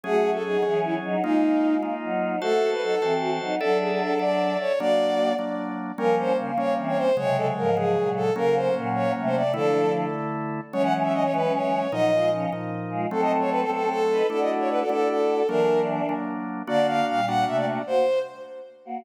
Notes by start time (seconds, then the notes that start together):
0.03 F#3 A3 C#4 F#4 G#4
0.33 A4
0.44 F#3 D#4 G#4
0.62 E3 F#3 C#4 G#4
0.84 E4
1.04 F#3 D#4
1.23 G#3 A#3 D#4 F4
1.82 A#3 D#4 F4
2.03 F#3 D#4
2.41 A3 F#4 A4 C5 A5
2.72 B4
2.82 F#3 D#4 A4
3.01 E3 C4 F#4 C5 A5
3.21 F#4
3.40 F#3 D#4
3.60 F#3 D4 A4 D5 E5
3.81 G#4
3.91 G#4
4.00 A4
4.19 A4 D5 E5
4.60 C#5
4.79 F#3 A#3 D4 F#4 D5
5.39 F#3 A#3 D4
5.98 F3 G3 A#3 C#4 A#4
6.18 C5
6.38 C#3 A#3
6.58 G3 A#3 C#4 C#5
6.77 E3 C4
6.88 C#5
6.97 C5
7.17 C3 C#3 F#3 G#3 C#5
7.37 A4
7.57 G#2 F3 A#4
7.77 C#3 F#3 G#3 G#4
7.96 A#2 F#3
8.16 A4
8.36 C#3 F#3 A#3 C#4 A#4
8.55 C5
8.75 A#2 F#3
8.95 C#5
9.17 C3 A3
9.26 C5
9.35 D5
9.54 D3 F3 A3 D4 E4 A4
10.73 E3 F#3 G#3 C#4 C#5
10.84 F#5
11.03 E5
11.13 D#5
11.23 C#5
11.33 F#3 G#3 C#4 B4
11.53 C#5
11.92 A#2 F3 F#3 D#4 D#5
12.13 G#3 F4
12.32 F3 C#4
12.52 A#2 F3 D#4
12.90 G#3 F4
13.11 F#3 A3 C4 A4
13.22 D#5
13.40 C#5
13.51 B4
13.61 A4
13.69 F#3 A3 C4 A4
13.90 A4
14.11 D#4 B4
14.30 A3 D4 E4 F#4 A4 D5
14.41 D#5
14.59 C#5
14.70 B4
14.80 A4
14.89 A3 D4 E4 A4
15.09 A4
15.48 E3 F#3 A#3 D4 A#4
16.09 F#3 A#3 D4
16.67 D3 A#3 D4 F#4 D5
16.87 F5
17.07 A#2 G3 F5
17.27 A#3 D4 F#4 F#5
17.47 C3 A3 E5
17.56 D5
17.87 A#3 F#4 C5
18.85 A#3 F#4